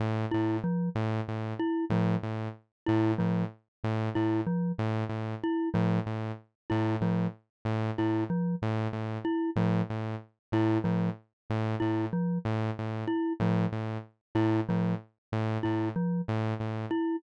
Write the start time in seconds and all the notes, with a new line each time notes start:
0.00 A2
0.31 A2 E4
0.64 F3
0.95 A2
1.28 A2
1.59 E4
1.90 A2 F3
2.23 A2
2.86 A2 E4
3.18 A2 F3
3.84 A2
4.15 A2 E4
4.47 F3
4.78 A2
5.09 A2
5.43 E4
5.74 A2 F3
6.06 A2
6.70 A2 E4
7.01 A2 F3
7.65 A2
7.98 A2 E4
8.30 F3
8.62 A2
8.93 A2
9.25 E4
9.56 A2 F3
9.90 A2
10.52 A2 E4
10.84 A2 F3
11.50 A2
11.80 A2 E4
12.13 F3
12.45 A2
12.79 A2
13.07 E4
13.40 A2 F3
13.72 A2
14.35 A2 E4
14.69 A2 F3
15.32 A2
15.63 A2 E4
15.96 F3
16.28 A2
16.60 A2
16.91 E4